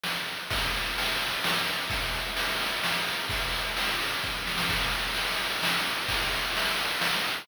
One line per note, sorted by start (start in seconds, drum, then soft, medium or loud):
0.03 snare loud
0.28 ride medium
0.50 kick loud
0.50 ride loud
0.74 ride medium
0.98 ride loud
1.21 ride medium
1.44 snare loud
1.67 ride medium
1.90 kick loud
1.90 ride loud
2.13 ride medium
2.37 ride loud
2.60 ride medium
2.84 snare loud
3.06 ride medium
3.29 kick loud
3.29 ride loud
3.53 ride medium
3.77 ride loud
4.00 ride medium
4.23 kick medium
4.23 snare medium
4.47 snare medium
4.58 snare loud
4.69 kick loud
4.69 crash loud
4.80 ride medium
4.93 ride medium
5.04 ride medium
5.15 ride loud
5.28 ride medium
5.38 ride medium
5.50 ride medium
5.63 snare loud
5.74 ride medium
5.85 ride medium
5.97 ride medium
6.08 kick loud
6.08 ride loud
6.20 ride medium
6.32 ride medium
6.43 ride medium
6.57 ride loud
6.67 ride medium
6.79 ride medium
6.89 ride medium
7.01 snare loud
7.13 ride medium
7.24 ride medium
7.37 ride medium